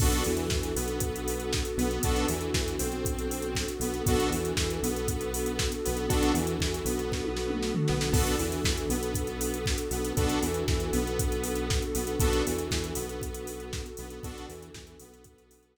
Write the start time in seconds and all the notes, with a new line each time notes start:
0.00 B1 B3 D4 F#4 A4, kick, crash
0.12 closed hi-hat
0.24 E2 E3, open hi-hat
0.37 closed hi-hat
0.50 E2 E3, kick, snare
0.63 closed hi-hat
0.75 B1 B3, open hi-hat
0.88 closed hi-hat
1.00 kick, closed hi-hat
1.16 closed hi-hat
1.28 open hi-hat
1.40 closed hi-hat
1.53 kick, snare
1.65 closed hi-hat
1.77 B1 B3, open hi-hat
1.91 closed hi-hat
2.02 B1 B3 D4 F#4 A4, kick, closed hi-hat
2.16 closed hi-hat
2.28 E2 E3, open hi-hat
2.41 closed hi-hat
2.54 E2 E3, kick, snare
2.68 closed hi-hat
2.79 B1 C4, open hi-hat
2.92 closed hi-hat
3.05 kick, closed hi-hat
3.19 closed hi-hat
3.31 open hi-hat
3.42 closed hi-hat
3.55 kick, snare
3.68 closed hi-hat
3.80 B1 B3, open hi-hat
3.94 closed hi-hat
4.06 B1 B3 D4 F#4 A4, kick, closed hi-hat
4.20 closed hi-hat
4.30 E2 E3, open hi-hat
4.45 closed hi-hat
4.57 E2 E3, kick, snare
4.70 closed hi-hat
4.82 B1 B3, open hi-hat
4.96 closed hi-hat
5.08 kick, closed hi-hat
5.21 closed hi-hat
5.34 open hi-hat
5.46 closed hi-hat
5.59 kick, snare
5.72 closed hi-hat
5.85 B1 B3, open hi-hat
5.97 closed hi-hat
6.09 B1 B3 D4 F#4 A4, kick, closed hi-hat
6.23 closed hi-hat
6.34 E2 E3, open hi-hat
6.47 closed hi-hat
6.59 E2 E3, kick, snare
6.74 closed hi-hat
6.85 B1 B3, open hi-hat
6.99 closed hi-hat
7.12 kick, snare
7.24 high tom
7.37 snare
7.50 mid tom
7.63 snare
7.75 floor tom
7.88 B1 B3, snare
8.01 snare
8.13 B1 B3 D4 F#4 A4, kick, crash
8.27 closed hi-hat
8.39 E2 E3, open hi-hat
8.52 closed hi-hat
8.64 E2 E3, kick, snare
8.78 closed hi-hat
8.89 B1 B3, open hi-hat
9.03 closed hi-hat
9.15 kick, closed hi-hat
9.27 closed hi-hat
9.41 open hi-hat
9.54 closed hi-hat
9.66 kick, snare
9.78 closed hi-hat
9.91 B1 B3, open hi-hat
10.05 closed hi-hat
10.17 B1 B3 D4 F#4 A4, kick, closed hi-hat
10.29 closed hi-hat
10.42 E2 E3, open hi-hat
10.54 closed hi-hat
10.68 E2 E3, kick, snare
10.80 closed hi-hat
10.92 B1 B3, open hi-hat
11.07 closed hi-hat
11.19 kick, closed hi-hat
11.32 closed hi-hat
11.44 open hi-hat
11.56 closed hi-hat
11.70 kick, snare
11.82 closed hi-hat
11.94 B1 B3, open hi-hat
12.07 closed hi-hat
12.20 B1 B3 D4 F#4 A4, kick, closed hi-hat
12.33 closed hi-hat
12.47 E2 E3, open hi-hat
12.58 closed hi-hat
12.71 E2 E3, kick, snare
12.84 closed hi-hat
12.95 B1 B3, open hi-hat
13.09 closed hi-hat
13.22 kick, closed hi-hat
13.35 closed hi-hat
13.47 open hi-hat
13.60 closed hi-hat
13.73 kick, snare
13.86 closed hi-hat
13.97 B1 B3, open hi-hat
14.10 closed hi-hat
14.23 B1 B3 D4 F#4 A4, kick, closed hi-hat
14.38 closed hi-hat
14.49 E2 E3, open hi-hat
14.63 closed hi-hat
14.74 E2 E3, kick, snare
14.87 closed hi-hat
14.99 B1 B3, open hi-hat
15.14 closed hi-hat
15.24 kick, closed hi-hat
15.38 closed hi-hat
15.51 open hi-hat
15.63 closed hi-hat
15.76 snare